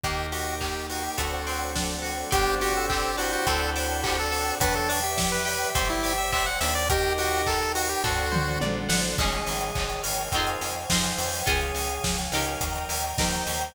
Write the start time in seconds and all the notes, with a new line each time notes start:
0.04 D#2 A#3 D#4 G4 A#4 D#5 G5, kick, closed hi-hat
0.32 F#4 G4, open hi-hat
0.61 A#3 G4, kick, clap
0.90 D#4 F#4, open hi-hat
1.04 G4
1.18 D2 A3 C4 D4 F#4 A4 C5 D5 F#5, kick, closed hi-hat
1.47 C4, open hi-hat
1.75 D4, kick, snare
2.02 F#4, open hi-hat
2.31 G1 B3 C4 D4 G4 C5 D5 G5, kick, closed hi-hat
2.61 F#4 G4, open hi-hat
2.77 C4 A4
2.90 C4 G4, kick, clap
3.17 D4 E4 F#4 C5, open hi-hat
3.33 F#4
3.46 D2 C4 D4 F#4 A4 C5 D5 F#5 A5, kick, closed hi-hat
3.76 D4, open hi-hat
4.03 F#4 G4, kick, clap
4.19 A4
4.31 A4, open hi-hat
4.60 E2 F#3 B3 D4 B4 D5 E5 G5, kick, closed hi-hat
4.75 A4
4.89 D4, open hi-hat
5.03 G4 E5
5.17 E4, kick, snare
5.32 B4
5.45 G4 E5, open hi-hat
5.75 G1 C4 C5 D5 G5, kick, closed hi-hat
5.90 E4
6.03 G4, open hi-hat
6.18 E5
6.33 C4 E5, kick, clap
6.46 F#5
6.60 D#2 D4 E5, open hi-hat
6.75 D5
6.90 D#4 G4 A#4 D#5 G5, kick, closed hi-hat
7.18 F#4 G5, open hi-hat
7.46 A4 A#4, kick, clap
7.75 F#4 D#5, open hi-hat
7.89 G4
8.03 D2 D4 F#4 A4 C5 D5 F#5, kick, floor tom
8.32 C5, mid tom
8.61 A#1 D5, high tom
8.89 A1 F#5, snare
9.18 G#1 C#4 D#4 G#4 C#5 D#5 G#5, kick, crash
9.33 closed hi-hat
9.47 G#1, open hi-hat
9.61 closed hi-hat
9.75 G#1, kick, clap
9.90 closed hi-hat
10.03 G#1 A#4, open hi-hat
10.18 closed hi-hat
10.32 F2 C4 D#4 C5 D#5 F5 G#5, kick, closed hi-hat
10.36 F4 G#4
10.47 closed hi-hat
10.61 F2, open hi-hat
10.75 closed hi-hat
10.90 F2 C4 D#4 F4 G#4 C5, kick, snare
11.04 closed hi-hat
11.18 F2, open hi-hat
11.33 open hi-hat
11.46 C#2 C#4 F4 G#4 C#5 F5 G#5, kick, closed hi-hat
11.61 closed hi-hat
11.75 C#2, open hi-hat
11.89 closed hi-hat
12.04 C#2, kick, snare
12.18 closed hi-hat
12.32 C#2 D#4 G4 A#4, open hi-hat
12.47 closed hi-hat
12.61 D#2 D#5 G5 A#5, kick, closed hi-hat
12.76 closed hi-hat
12.89 D#2, open hi-hat
13.04 closed hi-hat
13.18 D#2 D#4 G4 A#4 C5, kick, snare
13.33 closed hi-hat
13.47 D#2, open hi-hat
13.61 closed hi-hat